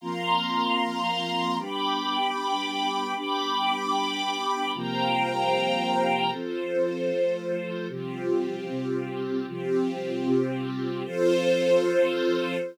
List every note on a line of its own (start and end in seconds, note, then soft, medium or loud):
0.01 1.58 F3 loud
0.01 1.58 A#3 loud
0.01 1.58 C4 medium
0.01 1.57 F5 medium
0.01 1.57 A#5 medium
0.01 1.57 C6 medium
1.58 3.14 G3 medium
1.58 3.14 B3 medium
1.58 3.14 D4 medium
1.58 3.14 G5 medium
1.58 3.14 B5 medium
1.58 3.14 D6 medium
3.15 4.72 G3 medium
3.15 4.72 B3 medium
3.15 4.72 D4 medium
3.15 4.71 G5 medium
3.15 4.71 B5 medium
3.15 4.71 D6 medium
4.74 6.31 C3 medium
4.74 6.31 F3 medium
4.74 6.31 G3 medium
4.74 6.31 A#3 medium
4.74 6.30 C5 medium
4.74 6.31 F5 medium
4.74 6.31 G5 medium
4.74 6.31 A#5 medium
6.31 7.10 F3 loud
6.31 7.10 C4 medium
6.31 7.87 F4 medium
6.31 7.87 A4 medium
6.31 7.10 A4 loud
6.31 7.87 C5 medium
7.11 7.88 F3 loud
7.11 7.89 A3 medium
7.11 7.89 A4 medium
7.89 8.67 C3 loud
7.89 8.67 F3 loud
7.89 8.67 G3 medium
7.89 9.46 C4 medium
7.89 9.46 F4 medium
7.89 9.46 G4 medium
8.69 9.47 C3 loud
8.69 9.47 G3 medium
8.69 9.47 C4 loud
9.47 10.25 C3 loud
9.47 10.25 F3 medium
9.47 10.25 G3 loud
9.47 11.03 C4 medium
9.47 11.03 F4 medium
9.47 11.03 G4 medium
10.26 11.04 C3 loud
10.26 11.04 G3 loud
10.26 11.04 C4 loud
11.04 12.58 F3 loud
11.04 12.58 C4 loud
11.04 12.57 F4 loud
11.04 12.57 A4 loud
11.04 12.58 A4 loud
11.04 12.57 C5 loud